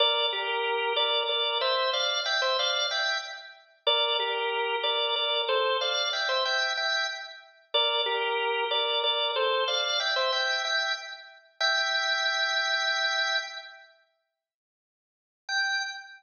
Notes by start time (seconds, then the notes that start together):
0.00 A#4 D5
0.33 G4 A#4
0.96 A#4 D5
1.29 A#4 D5
1.61 C5 E5
1.93 D5 F5
2.26 E5 G5
2.42 C5 E5
2.59 D5 F5
2.91 E5 G5
3.87 A#4 D5
4.19 G4 A#4
4.83 A#4 D5
5.16 A#4 D5
5.49 A4 C5
5.81 D5 F5
6.13 E5 G5
6.29 C5 E5
6.45 E5 G5
6.77 E5 G5
7.74 A#4 D5
8.06 G4 A#4
8.71 A#4 D5
9.03 A#4 D5
9.36 A4 C5
9.68 D5 F5
10.00 E5 G5
10.16 C5 E5
10.32 E5 G5
10.65 E5 G5
11.60 E5 G5
15.49 G5